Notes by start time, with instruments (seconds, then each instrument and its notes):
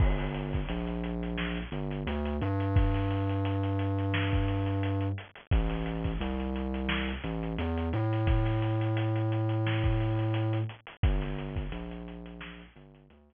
0.00 synth bass 2 G1, kick, crash
0.18 snare, closed hi-hat
0.34 closed hi-hat
0.53 kick, closed hi-hat
0.69 synth bass 2 A#1, closed hi-hat
0.87 closed hi-hat
1.04 closed hi-hat
1.23 closed hi-hat
1.37 snare
1.57 closed hi-hat
1.72 synth bass 2 G1, closed hi-hat
1.91 closed hi-hat
2.07 synth bass 2 D2, closed hi-hat
2.25 closed hi-hat
2.41 synth bass 2 G2, closed hi-hat
2.60 closed hi-hat
2.76 kick, closed hi-hat
2.94 snare, closed hi-hat
3.10 snare, closed hi-hat
3.29 closed hi-hat
3.45 closed hi-hat
3.63 closed hi-hat
3.79 closed hi-hat
3.98 closed hi-hat
4.14 snare
4.33 kick, closed hi-hat
4.48 closed hi-hat
4.66 closed hi-hat
4.83 closed hi-hat
5.01 closed hi-hat
5.18 closed hi-hat
5.35 closed hi-hat
5.51 synth bass 2 A1, kick, closed hi-hat
5.70 snare, closed hi-hat
5.86 closed hi-hat
6.04 kick, closed hi-hat
6.21 synth bass 2 C2, closed hi-hat
6.40 closed hi-hat
6.56 closed hi-hat
6.74 closed hi-hat
6.89 snare
7.08 closed hi-hat
7.24 synth bass 2 A1, closed hi-hat
7.43 closed hi-hat
7.58 synth bass 2 E2, closed hi-hat
7.77 closed hi-hat
7.93 synth bass 2 A2, snare, closed hi-hat
8.13 closed hi-hat
8.27 kick, closed hi-hat
8.46 snare, closed hi-hat
8.62 closed hi-hat
8.81 closed hi-hat
8.97 closed hi-hat
9.16 closed hi-hat
9.32 closed hi-hat
9.49 closed hi-hat
9.67 snare
9.84 kick, closed hi-hat
10.00 closed hi-hat
10.19 snare, closed hi-hat
10.34 closed hi-hat
10.53 closed hi-hat
10.69 closed hi-hat
10.87 closed hi-hat
11.03 synth bass 2 G1, kick, closed hi-hat
11.22 snare, closed hi-hat
11.38 snare, closed hi-hat
11.56 kick, closed hi-hat
11.72 synth bass 2 A#1, closed hi-hat
11.91 closed hi-hat
12.08 closed hi-hat
12.26 closed hi-hat
12.41 snare
12.59 closed hi-hat
12.76 synth bass 2 G1, closed hi-hat
12.95 closed hi-hat
13.10 synth bass 2 D2, closed hi-hat
13.30 closed hi-hat